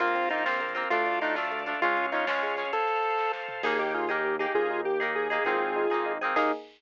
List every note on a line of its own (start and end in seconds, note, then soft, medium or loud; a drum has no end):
0.00 0.84 A#1 medium
0.00 0.13 A#3 medium
0.00 0.27 A#3 medium
0.00 0.27 C4 medium
0.00 0.27 F4 medium
0.00 0.29 F4 medium
0.00 0.89 A#4 medium
0.00 0.89 C5 medium
0.00 0.89 F5 medium
0.00 kick medium
0.00 closed hi-hat medium
0.07 closed hi-hat medium
0.15 0.28 C4 medium
0.15 closed hi-hat medium
0.23 closed hi-hat medium
0.30 0.45 A#3 medium
0.30 0.45 C4 medium
0.30 0.45 D#4 medium
0.30 0.44 F4 medium
0.30 0.45 F4 medium
0.30 closed hi-hat medium
0.38 closed hi-hat medium
0.46 0.74 A#3 medium
0.46 0.59 C4 medium
0.46 0.74 C4 medium
0.46 0.74 F4 medium
0.46 snare medium
0.53 closed hi-hat medium
0.61 0.74 A#3 medium
0.61 closed hi-hat medium
0.68 closed hi-hat medium
0.75 0.89 A#3 medium
0.75 0.89 C4 medium
0.75 0.89 F4 medium
0.75 closed hi-hat medium
0.83 closed hi-hat medium
0.90 1.74 D2 medium
0.90 1.05 A3 medium
0.90 1.19 A3 medium
0.90 1.19 D4 medium
0.90 1.20 F4 medium
0.90 1.19 F4 medium
0.90 1.81 A4 medium
0.90 1.81 D5 medium
0.90 1.81 F5 medium
0.90 kick medium
0.90 closed hi-hat medium
0.98 closed hi-hat medium
1.06 1.20 D4 medium
1.06 closed hi-hat medium
1.14 closed hi-hat medium
1.21 1.35 A3 medium
1.21 1.35 D4 medium
1.21 1.36 D#4 medium
1.21 1.35 F4 medium
1.21 closed hi-hat medium
1.29 closed hi-hat medium
1.35 1.63 A3 medium
1.35 1.50 D4 medium
1.35 1.63 D4 medium
1.35 1.63 F4 medium
1.35 snare medium
1.44 closed hi-hat medium
1.51 1.65 A3 medium
1.51 closed hi-hat medium
1.59 closed hi-hat medium
1.66 1.80 A3 medium
1.66 1.80 D4 medium
1.66 1.80 F4 medium
1.66 closed hi-hat medium
1.74 closed hi-hat medium
1.81 2.64 C#2 medium
1.81 1.96 G#3 medium
1.81 2.10 G#3 medium
1.81 2.10 C#4 medium
1.81 2.06 F4 medium
1.81 2.10 F4 medium
1.81 2.73 G#4 medium
1.81 2.73 C#5 medium
1.81 2.72 F5 medium
1.81 kick medium
1.81 closed hi-hat medium
1.90 closed hi-hat medium
1.97 2.11 C#4 medium
1.97 closed hi-hat medium
2.05 closed hi-hat medium
2.12 2.26 G#3 medium
2.12 2.26 C#4 medium
2.12 2.26 D#4 medium
2.12 2.26 F4 medium
2.12 closed hi-hat medium
2.20 closed hi-hat medium
2.27 2.55 G#3 medium
2.27 2.41 C#4 medium
2.27 2.55 C#4 medium
2.27 2.55 F4 medium
2.27 snare loud
2.35 closed hi-hat soft
2.43 2.57 G#3 medium
2.43 closed hi-hat medium
2.50 closed hi-hat medium
2.57 2.71 G#3 medium
2.57 2.71 C#4 medium
2.57 2.71 F4 medium
2.57 closed hi-hat medium
2.65 closed hi-hat medium
2.72 3.62 A4 medium
2.72 3.32 A4 medium
2.72 3.62 C5 medium
2.72 3.62 F5 medium
2.72 kick medium
2.72 closed hi-hat medium
2.80 closed hi-hat medium
2.88 closed hi-hat medium
2.96 closed hi-hat medium
3.03 closed hi-hat medium
3.10 closed hi-hat medium
3.18 kick medium
3.18 snare medium
3.33 snare medium
3.48 floor tom medium
3.63 4.47 D#2 loud
3.63 3.78 A#3 medium
3.63 4.05 A#3 medium
3.63 4.05 D#4 medium
3.63 4.05 G#4 medium
3.63 3.78 G#4 loud
3.63 kick medium
3.63 crash loud
3.79 3.92 D#4 medium
3.79 3.93 G4 loud
3.94 4.09 F4 loud
3.94 4.08 G#4 medium
4.09 4.37 A#3 medium
4.09 4.23 D#4 medium
4.09 4.37 D#4 medium
4.09 4.35 G4 medium
4.09 4.37 G#4 medium
4.24 4.38 A#3 medium
4.39 4.95 A#3 medium
4.39 4.53 D#4 medium
4.39 4.95 D#4 medium
4.39 4.53 G4 loud
4.39 4.95 G#4 medium
4.55 5.39 D#2 medium
4.55 4.81 F4 loud
4.55 4.68 G#4 medium
4.55 4.81 G#4 loud
4.55 kick loud
4.70 4.84 D#4 medium
4.85 4.98 A#3 medium
4.85 5.11 G4 medium
5.00 5.28 A#3 medium
5.00 5.14 D#4 medium
5.00 5.28 D#4 medium
5.00 5.28 G#4 medium
5.15 5.29 G#4 medium
5.15 5.44 G#4 loud
5.30 5.44 A#3 medium
5.30 5.44 D#4 medium
5.30 5.44 G#4 medium
5.45 5.87 G#1 loud
5.45 5.59 A#3 medium
5.45 5.86 A#3 medium
5.45 5.86 C4 medium
5.45 5.86 D#4 medium
5.45 6.12 F4 loud
5.45 5.86 G#4 medium
5.45 6.12 G#4 loud
5.45 kick loud
5.60 5.74 C4 medium
5.76 5.89 D#4 medium
5.90 6.33 G#1 medium
5.90 6.18 A#3 medium
5.90 6.18 C4 medium
5.90 6.18 D#4 medium
5.90 6.18 G#4 medium
5.90 6.05 G#4 medium
6.06 6.20 D#4 medium
6.21 6.35 C4 medium
6.21 6.35 D#4 medium
6.21 6.35 G#4 medium
6.25 6.35 A#3 medium
6.36 6.52 D#2 loud
6.36 6.52 A#3 loud
6.36 6.52 D#4 loud
6.36 6.52 G#4 loud
6.36 kick loud
6.36 crash loud